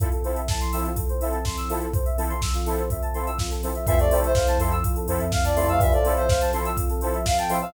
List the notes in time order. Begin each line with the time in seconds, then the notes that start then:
0.00 F3 C4 E4 F4 A4, kick, closed hi-hat
0.12 A4, closed hi-hat
0.24 F3 C4 E4 A4 C5, open hi-hat
0.36 E5, closed hi-hat
0.48 A5, kick, snare
0.61 C6, closed hi-hat
0.72 F3 C4 E4 A4 E6, open hi-hat
0.85 F4, closed hi-hat
0.96 A4, kick, closed hi-hat
1.09 C5, closed hi-hat
1.21 F3 C4 E4 A4 E5, open hi-hat
1.33 A5, closed hi-hat
1.45 C6, kick, snare
1.57 E6, closed hi-hat
1.69 F3 C4 E4 F4 A4, open hi-hat
1.81 A4, closed hi-hat
1.93 F3 C4 F4 A4 C5, kick, closed hi-hat
2.05 E5, closed hi-hat
2.17 F3 C4 E4 A4 A5, open hi-hat
2.30 C6, closed hi-hat
2.42 E6, kick, snare
2.54 F4, closed hi-hat
2.66 F3 C4 E4 A4, open hi-hat
2.78 C5, closed hi-hat
2.90 E5, kick, closed hi-hat
3.02 A5, closed hi-hat
3.14 F3 C4 E4 A4 C6, open hi-hat
3.27 E6, closed hi-hat
3.39 F4, kick, snare
3.51 A4, closed hi-hat
3.63 F3 C4 E4 A4 C5, open hi-hat
3.75 E5, closed hi-hat
3.87 F2 E3 F3 C4 E4 F4 A4 E5, kick, closed hi-hat
3.99 C3 A3 A4 D5, closed hi-hat
4.11 F3 C4 E4 A4 C5, open hi-hat
4.23 C5 E5, closed hi-hat
4.35 F5, kick, snare
4.47 A5, closed hi-hat
4.59 F2 F3 C4 E4 A4 C6, open hi-hat
4.71 E6, closed hi-hat
4.84 F4, kick, closed hi-hat
4.96 A4, closed hi-hat
5.08 F2 F3 C4 E4 A4 C5, open hi-hat
5.19 F2 E5, closed hi-hat
5.32 F5, kick, snare
5.44 F2 D5 A5, closed hi-hat
5.56 C3 F3 A3 C4 E4 A4 C6, open hi-hat
5.68 F2 C3 A3 F5 E6, closed hi-hat
5.80 G2 E3 F3 C4 F4 A4 E5, kick, closed hi-hat
5.92 A2 F3 A4 D5, closed hi-hat
6.05 F3 C4 E4 A4 C5, open hi-hat
6.17 C5 E5, closed hi-hat
6.29 F5, kick, snare
6.41 A5, closed hi-hat
6.53 F3 C4 E4 A4 C6, open hi-hat
6.65 E6, closed hi-hat
6.77 F4, kick, closed hi-hat
6.89 A4, closed hi-hat
7.01 F3 C4 E4 A4 C5, open hi-hat
7.14 E5, closed hi-hat
7.26 F5, kick, snare
7.38 G5 A5, closed hi-hat
7.49 A2 F3 C4 E4 A4 C6, open hi-hat
7.62 A2 F3 F5 E6, closed hi-hat